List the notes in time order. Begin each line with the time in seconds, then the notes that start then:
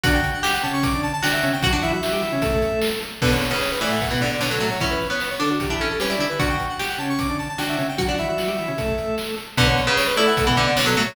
0.03 D3 D4 F#4 F#5, kick, closed hi-hat
0.14 G5
0.24 closed hi-hat
0.34 F#5
0.43 G4 G5, snare
0.53 F#5
0.63 C#3 C#4 A5, closed hi-hat
0.73 C#6
0.83 D6, kick, closed hi-hat
0.94 D3 D4
1.03 A5, closed hi-hat
1.13 A5
1.23 D3 D4 F#4 G5, snare
1.33 E5
1.43 C#3 C#4, closed hi-hat
1.53 G5
1.63 F#3 F#4 F#5, kick, closed hi-hat
1.73 D3 D4
1.82 E3 E4 E5, closed hi-hat
1.93 F#3 F#4 E5
2.02 F#3 F#4, snare
2.13 G3 G4
2.22 E3 E4, closed hi-hat
2.32 C#3 C#4
2.42 A3 A4, kick, closed hi-hat
2.52 kick
2.62 closed hi-hat
2.82 snare
3.02 closed hi-hat
3.22 B2 D3 B3 B4, kick, crash
3.31 C#5
3.42 closed hi-hat
3.51 C#3 B4
3.61 C#5, snare
3.71 B4
3.81 A2 E3 A3 D5, closed hi-hat
3.91 F#5
4.01 F#5, kick, closed hi-hat
4.11 B2 E3 B3
4.21 D3 D5, closed hi-hat
4.31 D5
4.41 B2 D3 B3 C#5, snare
4.51 F#3 A4
4.60 A2 F#3 A3, closed hi-hat
4.70 C#5
4.80 E3 C#4 E4 C#5, kick, closed hi-hat
4.91 B4
5.01 closed hi-hat
5.10 B3 C#5
5.20 B4, snare
5.30 C#5
5.39 D3 D4 A4, closed hi-hat
5.50 F#4
5.60 G4, kick, closed hi-hat
5.69 E3 D4 E4, kick
5.80 C#4 A4, closed hi-hat
5.90 A4
6.00 G3 C#4 G4 B4, snare
6.09 E4 D5
6.18 D3 D4 E4, closed hi-hat
6.29 B4
6.39 D3 D4 F#4 F#5, kick, closed hi-hat
6.50 G5
6.60 closed hi-hat
6.69 F#5
6.79 G4 G5, snare
6.89 F#5
6.98 C#3 C#4 A5, closed hi-hat
7.10 C#6
7.19 D6, kick, closed hi-hat
7.29 D3 D4
7.39 A5, closed hi-hat
7.49 A5
7.58 D3 D4 F#4 G5, snare
7.69 E5
7.78 C#3 C#4, closed hi-hat
7.89 G5
7.98 F#3 F#4 F#5, kick, closed hi-hat
8.08 D3 D4
8.18 E3 E4 E5, closed hi-hat
8.28 F#3 F#4 E5
8.38 F#3 F#4, snare
8.48 G3 G4
8.59 E3 E4, closed hi-hat
8.68 C#3 C#4
8.78 A3 A4, kick, closed hi-hat
8.88 kick
8.98 closed hi-hat
9.18 snare
9.37 closed hi-hat
9.57 B2 D3 B3 B4, kick, closed hi-hat
9.67 C#5
9.77 closed hi-hat
9.87 C#3 B4
9.97 C#5, snare
10.07 B4
10.16 A3 E4 A4 D5, closed hi-hat
10.27 F#5
10.37 F#5, kick, closed hi-hat
10.47 B2 E3 B3
10.56 D3 D5, closed hi-hat
10.67 D5
10.77 B2 D3 B3 C#5, snare
10.86 F#3 A4
10.97 A2 F#3 A3, closed hi-hat
11.07 C#5